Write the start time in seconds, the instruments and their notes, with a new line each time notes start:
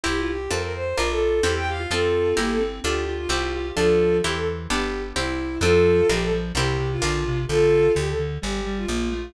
0.03 electric bass (finger) C2, acoustic guitar (steel) C4 E4 G4, clarinet E4, violin G4
0.17 violin F4
0.27 violin G4
0.51 electric bass (finger) F2, acoustic guitar (steel) C4 F4 A4, violin A#4
0.62 violin A#4
0.74 violin C5
0.97 electric bass (finger) A#1, acoustic guitar (steel) D4 F4 A#4, clarinet F4, violin A#4
1.10 violin A4
1.43 electric bass (finger) E2, acoustic guitar (steel) C4 E4 G4, violin G4, clarinet A4
1.56 violin G5
1.68 clarinet G4, violin F5
1.79 clarinet F4
1.90 electric bass (finger) F2, acoustic guitar (steel) C4 F4 A4, clarinet C4, violin F4 A4
2.37 electric bass (finger) G1, clarinet A#3, acoustic guitar (steel) E4 G4 A#4, violin G4
2.50 violin A4
2.60 clarinet C4
2.84 electric bass (finger) D2, acoustic guitar (steel) D4 F4 A4, clarinet F4, violin G4
3.08 clarinet F4
3.18 violin F4
3.29 electric bass (finger) C2, acoustic guitar (steel) C4 E4 G4, clarinet G4
3.55 clarinet G4
3.76 electric bass (finger) D2, clarinet F3, acoustic guitar (steel) D4 F4 A4, violin F4 A4
4.22 electric bass (finger) E2, clarinet E3, acoustic guitar (steel) C4 E4 G4, violin G4
4.35 violin A4
4.70 electric bass (finger) G1, acoustic guitar (steel) B3 D4 G4, violin G4
5.16 electric bass (finger) C2, acoustic guitar (steel) C4 E4 G4, violin E4
5.61 electric bass (finger) F2, clarinet F3, acoustic guitar (steel) C4 F4 A4, violin F4 A4
6.09 electric bass (finger) A#1, clarinet F3, acoustic guitar (steel) D4 F4 A#4, violin G4
6.21 violin A4
6.33 clarinet F3
6.55 electric bass (finger) C2, clarinet C3, acoustic guitar (steel) C4 E4 G4 A#4, violin G4
6.79 clarinet C3
6.91 violin F4
7.02 electric bass (finger) A#1, clarinet D3, acoustic guitar (steel) D4 F4 A#4
7.27 clarinet C3
7.48 electric bass (finger) A#1, clarinet D3, violin F4 A4
7.95 electric bass (finger) D2, clarinet D3, violin G4
8.07 violin A4
8.18 clarinet D3
8.42 electric bass (finger) G1, clarinet G3, violin G4
8.65 clarinet G3
8.77 violin F4
8.88 electric bass (finger) A#1, clarinet A#3
9.11 clarinet A3